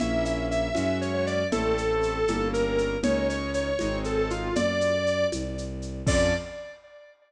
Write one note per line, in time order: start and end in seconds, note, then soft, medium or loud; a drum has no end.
0.00 0.70 A#1 medium
0.00 0.69 A#3 loud
0.00 0.69 C#4 loud
0.00 0.69 E4 medium
0.00 0.24 E5 medium
0.00 low conga medium
0.00 shaker medium
0.25 0.46 E5 medium
0.25 shaker medium
0.51 0.98 E5 medium
0.51 shaker medium
0.75 1.45 F#2 medium
0.75 1.43 G#3 medium
0.75 1.43 C#4 loud
0.75 1.43 F#4 loud
0.75 high conga medium
0.75 shaker medium
1.01 1.13 C#5 medium
1.01 shaker medium
1.14 1.26 C#5 medium
1.27 1.47 D5 medium
1.27 shaker medium
1.52 2.23 A1 medium
1.52 2.20 A3 loud
1.52 2.20 C4 loud
1.52 2.20 E4 medium
1.52 2.48 A4 medium
1.52 low conga loud
1.52 shaker medium
1.78 shaker medium
2.03 shaker medium
2.27 2.96 G1 medium
2.27 2.97 G3 medium
2.27 2.97 A#3 loud
2.27 2.97 C#4 loud
2.27 high conga medium
2.27 shaker medium
2.53 2.97 A#4 medium
2.53 shaker medium
2.78 shaker medium
3.02 3.72 C#2 medium
3.02 3.71 G#3 loud
3.02 3.71 C#4 loud
3.02 3.71 D#4 loud
3.02 3.27 C#5 medium
3.02 low conga loud
3.02 shaker medium
3.29 3.51 C#5 medium
3.29 shaker medium
3.54 3.98 C#5 medium
3.54 shaker medium
3.79 4.50 G#1 medium
3.79 4.49 G#3 loud
3.79 4.49 C4 loud
3.79 4.49 D#4 loud
3.79 high conga medium
3.79 shaker medium
4.04 4.17 A4 medium
4.04 shaker medium
4.18 4.30 A4 medium
4.30 4.54 F4 medium
4.30 shaker medium
4.55 5.25 F#2 medium
4.55 5.26 D5 medium
4.55 low conga loud
4.55 shaker medium
4.81 shaker medium
5.07 shaker medium
5.32 6.02 C2 medium
5.32 high conga medium
5.32 shaker medium
5.58 shaker medium
5.82 shaker medium
6.06 6.33 F2 loud
6.06 6.33 C#4 loud
6.06 6.33 F4 loud
6.06 6.33 A4 loud
6.06 6.34 D5 loud
6.06 kick loud
6.06 crash loud